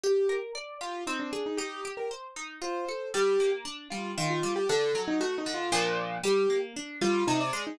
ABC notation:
X:1
M:3/4
L:1/16
Q:1/4=116
K:Gm
V:1 name="Acoustic Grand Piano"
G3 z3 F2 E D2 E | G3 B z4 c4 | G3 z3 F2 F F2 G | A3 E (3^F2 E2 =F2 z4 |
G3 z3 F2 E d2 E |]
V:2 name="Orchestral Harp"
G2 B2 d2 G2 C2 _A2 | E2 G2 c2 E2 F2 A2 | G,2 B,2 D2 G,2 E,2 G,2 | D,2 ^F,2 A,2 D,2 [B,,=F,D]4 |
G,2 B,2 D2 G,2 C,2 _A,2 |]